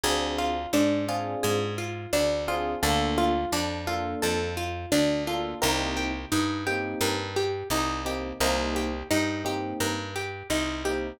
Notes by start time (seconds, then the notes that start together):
0.03 D2 C4 D4 F4 G#4
0.38 F4
0.73 G#2 D4
1.08 C4 D4 F4 G#4
1.43 G#2 G#4
1.78 F4
2.13 D2 D4
2.48 C4 D4 F4 G#4
2.82 D2 A#3 D4 F4 A4
3.18 F4
3.52 F2 D4
3.87 A#3 D4 F4 A4
4.22 F2 A4
4.57 F4
4.92 D2 D4
5.27 A#3 D4 F4 A4
5.61 C2 A#3 C4 D#4 G4 A#4
5.97 G4
6.32 G2 D#4
6.66 A#3 C4 D#4 G4
7.01 G2 A#4
7.36 G4
7.70 C2 D#4
8.05 A#3 C4 D#4 G4
8.40 C2 A#3 C4 D#4 G4 A#4
8.76 G4
9.10 G2 D#4
9.45 A#3 C4 D#4 G4
9.80 G2 A#4
10.16 G4
10.50 C2 D#4
10.85 A#3 C4 D#4 G4